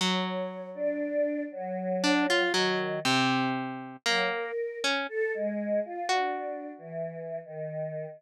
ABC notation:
X:1
M:3/4
L:1/16
Q:1/4=59
K:none
V:1 name="Harpsichord"
^F,8 D =F ^F,2 | C,4 ^A,2 z ^C z4 | ^F12 |]
V:2 name="Choir Aahs"
^c3 D3 ^F,4 ^D,2 | z4 ^F, ^A2 z =A ^G,2 =F | (3D4 E,4 ^D,4 z4 |]